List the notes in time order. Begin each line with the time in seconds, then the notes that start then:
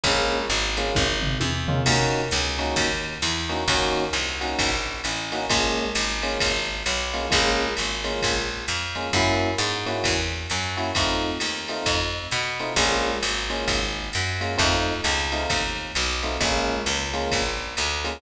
0.04 A#1 G#3 A#3 C#4 F4, kick, ride
0.50 G#1, ride
0.77 G#3 A#3 C#4 F4, hi-hat pedal, ride
0.95 G#1, kick, high tom
1.23 floor tom
1.40 E2, high tom
1.68 G#3 A#3 C#4 F4, floor tom
1.86 D#2 A#3 C#4 D#4 F#4, kick, crash, ride
2.31 C#2, hi-hat pedal, ride
2.59 A#3 C#4 D#4 F#4, ride
2.76 D#2, kick, ride
3.22 E2, hi-hat pedal, ride
3.49 A#3 C#4 D#4 F#4, ride
3.68 D#2 A#3 C#4 D#4 F#4, kick, ride
4.13 C2, hi-hat pedal, ride
4.41 A#3 C#4 D#4 F#4, ride
4.59 A#1, kick, ride
5.04 A1, hi-hat pedal, ride
5.32 A#3 C#4 D#4 F#4, ride
5.50 A#1 G#3 A#3 C#4 F4, kick, ride
5.95 G#1, hi-hat pedal, ride
6.23 G#3 A#3 C#4 F4, ride
6.40 G#1, kick, ride
6.86 B1, hi-hat pedal, ride
7.14 G#3 A#3 C#4 F4, ride
7.30 A#1 G#3 A#3 C#4 F4, kick, ride
7.77 G#1, hi-hat pedal, ride
8.04 G#3 A#3 C#4 F4, ride
8.22 A#1, kick, ride
8.68 F2, hi-hat pedal, ride
8.95 G#3 A#3 C#4 F4, ride
9.13 F#2 A#3 C#4 E4 F#4, kick, ride
9.58 G#2, hi-hat pedal, ride
9.86 A#3 C#4 E4 F#4, ride
10.04 E2, kick, ride
10.50 F#2, hi-hat pedal, ride
10.77 A#3 C#4 E4 F#4, ride
10.95 F2 A3 C4 D#4 F4, kick, ride
11.40 D#2, hi-hat pedal, ride
11.68 A3 C4 D#4 F4, ride
11.86 F2, kick, ride
12.31 B2, hi-hat pedal, ride
12.59 A3 C4 D#4 F4, ride
12.76 A#1 G#3 A#3 C#4 F4, kick, ride
13.23 G#1, hi-hat pedal, ride
13.50 G#3 A#3 C#4 F4, ride
13.68 G#1, kick, ride
14.13 F#2, hi-hat pedal, ride
14.41 G#3 A#3 C#4 F4, ride
14.58 F2 A3 C4 D#4 F4, kick, ride
15.04 C#2, hi-hat pedal, ride
15.32 A3 C4 D#4 F4, ride
15.50 D#2, kick, ride
15.95 B1, hi-hat pedal, ride
16.23 A3 C4 D#4 F4, ride
16.41 A#1 G#3 A#3 C#4 F4, kick, ride
16.86 C#2, hi-hat pedal, ride
17.14 G#3 A#3 C#4 F4, ride
17.31 A#1, kick, ride
17.77 D2, hi-hat pedal, ride
18.04 G#3 A#3 C#4 F4, ride